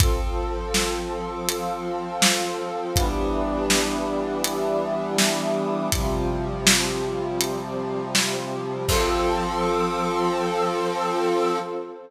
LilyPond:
<<
  \new Staff \with { instrumentName = "Brass Section" } { \time 4/4 \key f \lydian \tempo 4 = 81 <f c' a'>1 | <e g b d'>1 | <c f g>1 | <f c' a'>1 | }
  \new Staff \with { instrumentName = "Pad 2 (warm)" } { \time 4/4 \key f \lydian <f' a' c''>2 <f' c'' f''>2 | <e' g' b' d''>2 <e' g' d'' e''>2 | <c' f' g'>2 <c' g' c''>2 | <f' a' c''>1 | }
  \new DrumStaff \with { instrumentName = "Drums" } \drummode { \time 4/4 <hh bd>4 sn4 hh4 sn4 | <hh bd>4 sn4 hh4 sn4 | <hh bd>4 sn4 hh4 sn4 | <cymc bd>4 r4 r4 r4 | }
>>